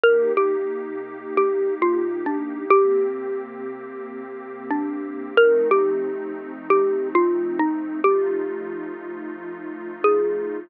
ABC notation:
X:1
M:4/4
L:1/8
Q:1/4=90
K:Eb
V:1 name="Xylophone"
B G3 (3G2 F2 D2 | G6 D2 | B G3 (3G2 F2 E2 | G6 A2 |]
V:2 name="Pad 2 (warm)"
[C,B,EG]8 | [C,B,CG]8 | [F,=A,CE]8 | [F,=A,EF]8 |]